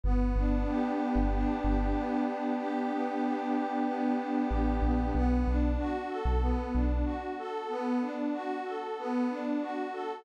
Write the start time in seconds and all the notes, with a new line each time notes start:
0.03 G1 B3
0.36 G1 D4
0.67 G4
1.00 B3
1.15 G1
1.33 D4
1.64 G1 G4
1.96 B3
2.27 D4
2.58 G4
2.91 B3
3.24 D4
3.54 G4
3.85 B3
4.18 D4
4.49 A1 G4
4.82 A#1 B3
5.15 B1 B3
5.47 B1 D4
5.79 F#4
6.09 A4
6.25 B1
6.41 B3
6.74 B1 D4
7.05 F#4
7.38 A4
7.69 B3
8.01 D4
8.33 F#4
8.65 A4
8.98 B3
9.30 D4
9.61 F#4
9.93 A4